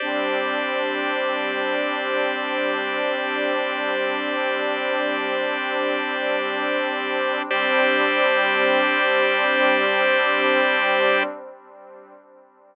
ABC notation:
X:1
M:4/4
L:1/8
Q:1/4=64
K:Gmix
V:1 name="Pad 2 (warm)"
[G,CD]8- | [G,CD]8 | [G,CD]8 |]
V:2 name="Drawbar Organ"
[Gcd]8- | [Gcd]8 | [Gcd]8 |]